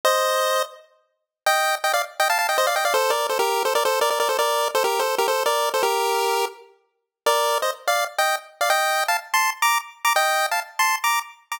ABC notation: X:1
M:4/4
L:1/16
Q:1/4=166
K:Gm
V:1 name="Lead 1 (square)"
[ce]8 z8 | [eg]4 [eg] [df] z2 [eg] [fa] [fa] [eg] [ce] [df] [eg] [df] | [Ac]2 [Bd]2 [Ac] [GB]3 [Ac] [Bd] [Ac]2 [Bd] [Bd] [Bd] [Ac] | [Bd]4 [Ac] [GB]2 [Ac]2 [GB] [Ac]2 [Bd]3 [Ac] |
[GB]8 z8 | [Bd]4 [ce] z2 [df]2 z [eg]2 z3 [df] | [eg]4 [fa] z2 [ac']2 z [bd']2 z3 [bd'] | [eg]4 [fa] z2 [ac']2 z [bd']2 z3 [bd'] |]